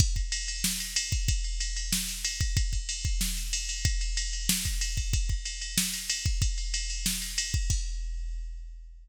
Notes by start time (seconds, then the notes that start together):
0.00 kick, crash
0.16 kick, ride
0.32 ride
0.48 ride
0.64 snare
0.80 ride
0.96 ride
1.12 kick, ride
1.28 kick, ride
1.44 ride
1.60 ride
1.76 ride
1.93 snare
2.08 ride
2.25 ride
2.41 kick, ride
2.57 kick, ride
2.73 kick, ride
2.89 ride
3.05 kick, ride
3.21 snare
3.37 ride
3.53 ride
3.69 ride
3.85 kick, ride
4.01 ride
4.17 ride
4.33 ride
4.49 snare
4.65 kick, ride
4.81 ride
4.97 kick, ride
5.13 kick, ride
5.29 kick, ride
5.45 ride
5.61 ride
5.78 snare
5.94 ride
6.10 ride
6.26 kick, ride
6.42 kick, ride
6.58 ride
6.74 ride
6.90 ride
7.06 snare
7.22 ride
7.38 ride
7.54 kick, ride
7.70 kick, crash